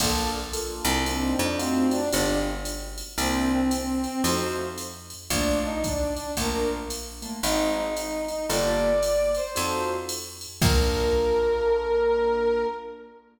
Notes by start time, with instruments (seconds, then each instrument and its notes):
0.00 electric bass (finger) A#1, acoustic grand piano A#3 D4 F4 A4, brass section A4, kick, crash, ride
0.53 acoustic grand piano A#3 D4 F4 A4, hi-hat pedal, ride
0.85 electric bass (finger) C2, ride
1.05 acoustic grand piano A#3 C4 D4 D#4, brass section C4, ride
1.39 electric bass (finger) F2, brass section D4
1.59 acoustic grand piano A3 D#4 F4 F#4, brass section C4, hi-hat pedal, ride
1.90 brass section D4, ride
2.12 electric bass (finger) G1, acoustic grand piano G#3 B3 F4 G4, brass section D4, ride
2.65 hi-hat pedal, ride
2.98 ride
3.18 electric bass (finger) C2, acoustic grand piano A#3 C4 D4 E4, brass section C4, ride
3.52 brass section C4
3.71 brass section C4, hi-hat pedal, ride
4.03 brass section C4, ride
4.24 electric bass (finger) F2, acoustic grand piano A3 D#4 F4 F#4, brass section C5, ride
4.78 hi-hat pedal, ride
5.10 ride
5.30 electric bass (finger) A#1, acoustic grand piano A3 A#3 D4 F4, brass section D4, kick, ride
5.64 brass section D#4
5.84 brass section D4, kick, hi-hat pedal, ride
6.14 brass section D4, ride
6.37 electric bass (finger) A#1, acoustic grand piano A3 A#3 D4 F4, brass section A#4, kick, ride
6.90 hi-hat pedal, ride
7.22 acoustic grand piano A3 A#3 D4 F4, ride
7.43 electric bass (finger) G#1, acoustic grand piano G#3 C4 D#4 F#4, brass section D#4, ride
7.76 brass section D#4
7.95 brass section D#4, hi-hat pedal, ride
8.28 brass section D#4, ride
8.49 electric bass (finger) G1, acoustic grand piano A#3 F4 G4 A4, brass section D5, ride
9.02 hi-hat pedal, ride
9.35 brass section C5, ride
9.55 electric bass (finger) F2, acoustic grand piano D#4 F4 F#4 A4, ride
10.09 hi-hat pedal, ride
10.41 ride
10.61 electric bass (finger) A#1, acoustic grand piano A#3 D4 F4 A4, brass section A#4, kick, crash